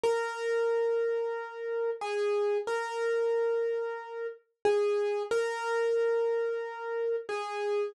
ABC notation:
X:1
M:4/4
L:1/8
Q:1/4=91
K:G#m
V:1 name="Acoustic Grand Piano"
A6 G2 | A6 G2 | A6 G2 |]